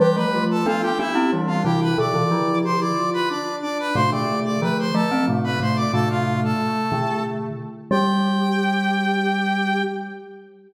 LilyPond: <<
  \new Staff \with { instrumentName = "Brass Section" } { \time 3/4 \key g \mixolydian \tempo 4 = 91 <g' g''>16 <b' b''>8 <a' a''>16 <f' f''>16 <g' g''>16 <e' e''>8 r16 <f' f''>16 <g' g''>16 <b' b''>16 | <d'' d'''>4 <c'' c'''>16 <d'' d'''>8 <b' b''>16 <d'' d'''>8 <d'' d'''>16 <b' b''>16 | <c'' c'''>16 <d'' d'''>8 <d'' d'''>16 <b' b''>16 <c'' c'''>16 <a' a''>8 r16 <b' b''>16 <c'' c'''>16 <d'' d'''>16 | <a' a''>16 <f' f''>8 <a' a''>4~ <a' a''>16 r4 |
g''2. | }
  \new Staff \with { instrumentName = "Ocarina" } { \time 3/4 \key g \mixolydian b'16 g'16 f'8 a'16 f'16 g'8 d'8 e'8 | a'16 f'16 e'8 g'16 e'16 f'8 d'8 d'8 | a16 a16 a8 a16 a16 a8 a8 a8 | a4. a4 r8 |
g'2. | }
  \new Staff \with { instrumentName = "Glockenspiel" } { \time 3/4 \key g \mixolydian <e g>16 <f a>8. <b d'>8 <b d'>16 <c' e'>16 <e g>8 <c e>8 | <b, d>16 <c e>16 <d f>4 r4. | <a, c>16 <b, d>8. <d f>8 <f a>16 <a c'>16 <a, c>8 <a, c>8 | <a, c>4 r8 <b, d>4 r8 |
g2. | }
>>